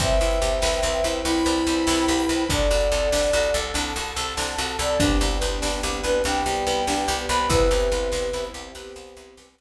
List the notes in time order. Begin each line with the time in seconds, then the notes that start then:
0.00 C2 C4 B4 C5 E5 G5, kick, closed hi-hat
0.21 C2 E4
0.31 closed hi-hat
0.42 C2 G4
0.62 C2 B4, snare
0.83 C2 C4
0.94 closed hi-hat
1.04 C2 E4
1.24 C2 E4 G4 B4 C5 G5 B5, closed hi-hat
1.45 C2 B4
1.56 closed hi-hat
1.67 C2 C4
1.87 C2 E4, snare
2.08 C2 G4
2.18 open hi-hat
2.29 C2 B4
2.49 C2 D4 A4 D5 F#5, kick, closed hi-hat
2.70 C2 F#4
2.81 closed hi-hat
2.92 C2 A4
3.12 C2 D4, snare
3.33 C2 F#4
3.43 closed hi-hat
3.54 C2 A4
3.74 C2 D4 A4 F#5 A5, closed hi-hat
3.96 C2 F#4
4.06 closed hi-hat
4.16 C2 A4
4.37 C2 D4, snare
4.58 C2 F#4
4.69 closed hi-hat
4.79 C2 A4 D5
5.00 C2 B3 D4 G4, kick, closed hi-hat
5.21 C2 G4
5.31 closed hi-hat
5.41 C2 B4
5.62 C2 D4, snare
5.83 C2 G4
5.94 closed hi-hat
6.03 C2 B4
6.24 C2 G3 B3 D4 G4 G5, closed hi-hat
6.46 C2 G4
6.56 closed hi-hat
6.67 C2 B4
6.87 C2 D4, snare
7.08 C2 G4
7.19 closed hi-hat
7.29 C2 B4 B5
7.49 C2 B3 C4 E4 G4 B4, kick, closed hi-hat
7.71 C2 G4
7.80 closed hi-hat
7.92 C2 B4
8.12 C2 C5, snare
8.33 C2 E4
8.45 closed hi-hat
8.54 C2 G4
8.75 C2 B3 C4 G4 B4, closed hi-hat
8.96 C2 C5
9.07 closed hi-hat
9.16 C2 E4
9.37 C2 G4, snare
9.58 C2 B4